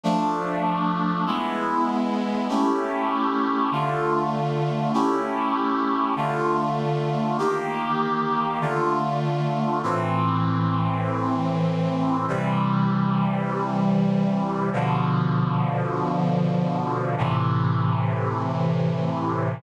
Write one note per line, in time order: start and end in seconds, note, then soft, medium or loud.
0.04 1.25 F3 medium
0.04 1.25 A3 medium
0.04 1.25 D4 medium
1.26 2.47 G#3 medium
1.26 2.47 B3 medium
1.26 2.47 E4 medium
2.49 3.70 A3 medium
2.49 3.70 C#4 medium
2.49 3.70 E4 medium
2.49 3.70 G4 medium
3.71 4.92 D3 medium
3.71 4.92 A3 medium
3.71 4.92 F4 medium
4.94 6.15 A3 medium
4.94 6.15 C#4 medium
4.94 6.15 E4 medium
4.94 6.15 G4 medium
6.16 7.37 D3 medium
6.16 7.37 A3 medium
6.16 7.37 F4 medium
7.38 8.59 D#3 medium
7.38 8.59 A#3 medium
7.38 8.59 G4 medium
8.61 9.82 D3 medium
8.61 9.82 A3 medium
8.61 9.82 F4 medium
9.83 12.26 A2 medium
9.83 12.26 E3 medium
9.83 12.26 C4 medium
12.28 14.70 C3 medium
12.28 14.70 E3 medium
12.28 14.70 G3 medium
14.73 17.15 B2 medium
14.73 17.15 D3 medium
14.73 17.15 F3 medium
17.18 19.60 A2 medium
17.18 19.60 C3 medium
17.18 19.60 E3 medium